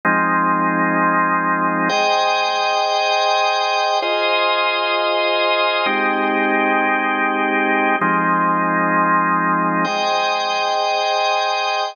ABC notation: X:1
M:7/8
L:1/8
Q:1/4=113
K:Ab
V:1 name="Drawbar Organ"
[F,A,CE]7 | [M:4/4] [Aceg]8 | [M:7/8] [FAce]7 | [M:4/4] [A,CEG]8 |
[M:7/8] [F,A,CE]7 | [M:4/4] [Aceg]8 |]